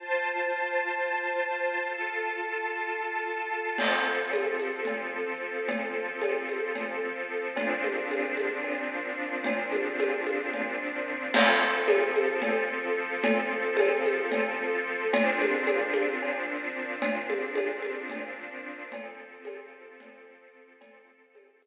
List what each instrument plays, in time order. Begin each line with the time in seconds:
0.00 string ensemble 1 F4 C5 A5
1.89 string ensemble 1 F4 A4 A5
3.78 string ensemble 1 F3 C4 A4, crash, cowbell, low conga
4.31 cowbell, high conga
4.59 high conga
4.85 cowbell, low conga
5.68 cowbell, low conga
6.22 cowbell, high conga
6.49 high conga
6.75 cowbell, low conga
7.55 string ensemble 1 A#2 F3 C4 D4, cowbell, low conga
7.84 high conga
8.11 cowbell, high conga
8.37 high conga
8.64 cowbell
9.44 cowbell, low conga
9.72 high conga
9.99 cowbell, high conga
10.27 high conga
10.53 cowbell, low conga
11.34 string ensemble 1 F3 C4 A4, crash, cowbell, low conga
11.88 cowbell, high conga
12.16 high conga
12.42 cowbell, low conga
13.24 cowbell, low conga
13.77 cowbell, high conga
14.06 high conga
14.32 cowbell, low conga
15.13 string ensemble 1 A#2 F3 C4 D4, cowbell, low conga
15.42 high conga
15.67 cowbell, high conga
15.94 high conga
16.22 cowbell
17.02 cowbell, low conga
17.30 high conga
17.55 cowbell, high conga
17.82 high conga
18.10 cowbell, low conga
18.92 string ensemble 1 F3 C4 A4, cowbell, low conga
19.45 cowbell, high conga
20.00 cowbell, low conga
20.81 string ensemble 1 F3 C4 A4, cowbell, low conga
21.35 cowbell, high conga
21.62 high conga